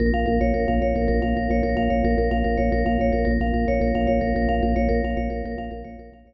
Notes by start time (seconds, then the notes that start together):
0.00 A#1 A#4
0.14 A#1 F5
0.26 A#1 A#4
0.41 A#1 C#5
0.54 A#1 A#4
0.68 A#1 F5
0.82 A#1 C#5
0.95 A#1 A#4
1.08 A#1 A#4
1.22 A#1 F5
1.36 A#1 A#4
1.50 A#1 C#5
1.63 A#1 A#4
1.77 A#1 F5
1.90 A#1 C#5
2.04 A#1 A#4
2.18 A#1 A#4
2.31 A#1 F5
2.44 A#1 A#4
2.57 A#1 C#5
2.72 A#1 A#4
2.86 A#1 F5
2.99 A#1 C#5
3.12 A#1 A#4
3.25 A#1 A#4
3.40 A#1 F5
3.54 A#1 A#4
3.67 A#1 C#5
3.81 A#1 A#4
3.95 A#1 F5
4.07 A#1 C#5
4.21 A#1 A#4
4.35 A#1 A#4
4.49 A#1 F5
4.63 A#1 A#4
4.76 A#1 C#5
4.89 A#1 A#4
5.03 A#1 F5
5.17 A#1 C#5
5.30 A#1 A#4
5.44 A#1 A#4
5.58 A#1 F5
5.71 A#1 A#4
5.84 A#1 C#5
5.99 A#1 A#4
6.12 A#1 F5
6.26 A#1 C#5